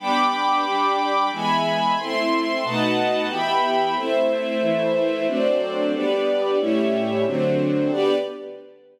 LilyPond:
<<
  \new Staff \with { instrumentName = "String Ensemble 1" } { \time 3/4 \key g \major \tempo 4 = 91 <g b d'>4 <g d' g'>4 <e gis b>4 | <a c' e'>4 <b, a dis' fis'>4 <e b g'>4 | <a c' e'>4 <e a e'>4 <fis a c' d'>4 | <g b d'>4 <a, g cis' e'>4 <d fis a c'>4 |
<g b d'>4 r2 | }
  \new Staff \with { instrumentName = "String Ensemble 1" } { \time 3/4 \key g \major <g'' b'' d'''>2 <e'' gis'' b''>4 | <a' e'' c'''>4 <b' dis'' fis'' a''>4 <e'' g'' b''>4 | <a' c'' e''>2 <fis' a' c'' d''>4 | <g' b' d''>4 <a g' cis'' e''>4 <d' fis' a' c''>4 |
<g' b' d''>4 r2 | }
>>